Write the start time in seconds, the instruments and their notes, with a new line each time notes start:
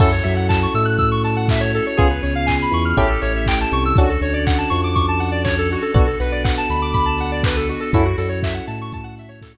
0.00 synth bass 2 F#2, electric piano 1 C#4 E4 F#4 A4, pad 5 (bowed) C#4 E4 F#4 A4, lead 1 (square) A4, kick, crash
0.12 lead 1 (square) C#5
0.23 synth bass 2 F#2, electric piano 1 F#3, lead 1 (square) E5, open hi-hat
0.36 lead 1 (square) F#5
0.49 lead 1 (square) A5, kick, clap
0.63 lead 1 (square) C#6
0.74 synth bass 2 A2, electric piano 1 A3, lead 1 (square) E6, open hi-hat
0.85 lead 1 (square) F#6
0.98 lead 1 (square) E6, kick, closed hi-hat
1.11 lead 1 (square) C#6
1.24 lead 1 (square) A5, open hi-hat
1.36 lead 1 (square) F#5
1.48 lead 1 (square) E5, kick, clap
1.60 lead 1 (square) C#5
1.73 lead 1 (square) A4, open hi-hat
1.87 lead 1 (square) C#5
1.97 synth bass 2 C#2, pad 5 (bowed) B3 C#4 F4 G#4, electric piano 1 B3 C#4 F4 G#4, lead 1 (square) G#4, kick, closed hi-hat
2.11 lead 1 (square) B4
2.23 synth bass 2 C#2, electric piano 1 C#3, lead 1 (square) C#5, open hi-hat
2.35 lead 1 (square) F5
2.46 lead 1 (square) G#5, kick, clap
2.62 lead 1 (square) B5
2.71 synth bass 2 E2, electric piano 1 E3, lead 1 (square) C#6, open hi-hat
2.85 lead 1 (square) F6
2.97 synth bass 2 A1, electric piano 1 C#4 E4 G4 A4, pad 5 (bowed) C#4 E4 G4 A4, lead 1 (square) G4, kick, closed hi-hat
3.09 lead 1 (square) A4
3.22 synth bass 2 A1, electric piano 1 A3, lead 1 (square) C#5, open hi-hat
3.36 lead 1 (square) E5
3.46 lead 1 (square) G5, kick, clap
3.61 lead 1 (square) A5
3.71 synth bass 2 C2, electric piano 1 C3, lead 1 (square) C#6, open hi-hat
3.85 lead 1 (square) E6
3.96 synth bass 2 D2, pad 5 (bowed) C#4 D4 F#4 A4, electric piano 1 C#4 D4 F#4 A4, lead 1 (square) F#4, kick, closed hi-hat
4.09 lead 1 (square) A4
4.21 synth bass 2 D2, electric piano 1 D3, lead 1 (square) C#5, open hi-hat
4.34 lead 1 (square) D5
4.47 lead 1 (square) F#5, kick, clap
4.58 lead 1 (square) A5
4.70 synth bass 2 F2, electric piano 1 F3, lead 1 (square) C#6, open hi-hat
4.84 lead 1 (square) D6
4.95 lead 1 (square) C#6, kick, closed hi-hat
5.08 lead 1 (square) A5
5.20 lead 1 (square) F#5, open hi-hat
5.32 lead 1 (square) D5
5.44 lead 1 (square) C#5, kick, clap
5.58 lead 1 (square) A4
5.70 lead 1 (square) F#4, open hi-hat
5.82 lead 1 (square) A4
5.94 synth bass 2 B1, electric piano 1 B3 D4 F#4 A4, pad 5 (bowed) B3 D4 F#4 A4, lead 1 (square) F#4, kick, closed hi-hat
6.07 lead 1 (square) A4
6.20 synth bass 2 B1, electric piano 1 B3, lead 1 (square) B4, open hi-hat
6.32 lead 1 (square) D5
6.44 lead 1 (square) F#5, kick, clap
6.58 lead 1 (square) A5
6.69 synth bass 2 D2, electric piano 1 D3, lead 1 (square) B5, open hi-hat
6.82 lead 1 (square) D6
6.94 lead 1 (square) B5, kick, closed hi-hat
7.06 lead 1 (square) A5
7.18 lead 1 (square) F#5, open hi-hat
7.32 lead 1 (square) D5
7.43 lead 1 (square) B4, kick, clap
7.57 lead 1 (square) A4
7.69 lead 1 (square) F#4, open hi-hat
7.80 lead 1 (square) A4
7.93 synth bass 2 F#2, pad 5 (bowed) C#4 E4 F#4 A4, electric piano 1 C#4 E4 F#4 A4, lead 1 (square) E4, kick, closed hi-hat
8.05 lead 1 (square) F#4
8.18 synth bass 2 F#2, electric piano 1 F#3, lead 1 (square) A4, open hi-hat
8.29 lead 1 (square) C#5
8.43 lead 1 (square) E5, kick, clap
8.54 lead 1 (square) F#5
8.67 synth bass 2 A2, electric piano 1 A3, lead 1 (square) A5, open hi-hat
8.81 lead 1 (square) C#6
8.92 lead 1 (square) A5, kick, closed hi-hat
9.04 lead 1 (square) F#5
9.18 lead 1 (square) E5, open hi-hat
9.29 lead 1 (square) C#5
9.42 lead 1 (square) A4, kick, clap
9.54 lead 1 (square) F#4